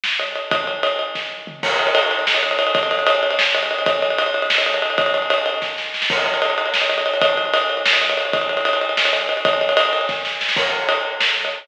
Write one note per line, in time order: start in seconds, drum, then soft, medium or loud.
0.04 snare medium
0.20 ride medium
0.36 ride medium
0.51 kick medium
0.51 ride medium
0.67 ride medium
0.83 ride medium
0.99 ride medium
1.15 kick medium
1.15 snare medium
1.47 floor tom medium
1.63 kick medium
1.63 crash loud
1.71 ride medium
1.79 ride medium
1.87 ride medium
1.95 ride medium
2.03 ride medium
2.11 ride medium
2.19 ride medium
2.27 snare medium
2.35 ride medium
2.43 ride medium
2.51 ride medium
2.59 ride medium
2.67 ride medium
2.75 kick medium
2.75 ride medium
2.83 ride medium
2.91 ride medium
2.99 ride medium
3.07 ride loud
3.15 ride medium
3.23 ride medium
3.31 ride medium
3.39 snare loud
3.55 ride medium
3.63 ride medium
3.71 ride medium
3.79 ride medium
3.86 kick medium
3.86 ride medium
3.95 ride medium
4.02 ride medium
4.10 ride medium
4.18 ride medium
4.26 ride medium
4.34 ride medium
4.42 ride medium
4.50 snare loud
4.58 ride medium
4.66 ride medium
4.74 ride medium
4.82 ride medium
4.90 ride medium
4.98 kick medium
4.98 ride medium
5.06 ride medium
5.14 ride medium
5.22 ride medium
5.30 ride medium
5.38 ride medium
5.46 ride medium
5.54 ride medium
5.62 kick medium
5.62 snare medium
5.78 snare medium
5.94 snare medium
6.02 snare medium
6.10 kick medium
6.10 crash medium
6.18 ride medium
6.26 ride medium
6.34 ride medium
6.42 ride medium
6.50 ride medium
6.58 ride medium
6.66 ride medium
6.74 snare medium
6.82 ride medium
6.89 ride medium
6.98 ride medium
7.06 ride medium
7.14 ride medium
7.21 kick medium
7.21 ride medium
7.30 ride medium
7.37 ride medium
7.45 ride soft
7.54 ride medium
7.62 ride medium
7.70 ride medium
7.77 ride medium
7.86 snare loud
7.93 ride medium
8.01 ride medium
8.10 ride medium
8.17 ride medium
8.25 ride medium
8.33 kick medium
8.33 ride medium
8.41 ride medium
8.49 ride medium
8.57 ride medium
8.65 ride medium
8.73 ride medium
8.81 ride medium
8.89 ride medium
8.97 snare loud
9.05 ride medium
9.13 ride medium
9.21 ride medium
9.29 ride medium
9.37 ride medium
9.45 kick medium
9.45 ride medium
9.53 ride medium
9.61 ride medium
9.69 ride medium
9.77 ride loud
9.85 ride medium
9.93 ride medium
10.01 ride medium
10.09 kick medium
10.09 snare medium
10.25 snare medium
10.41 snare medium
10.49 snare medium
10.57 kick medium
10.57 crash medium
10.89 ride medium
11.21 snare loud
11.45 ride medium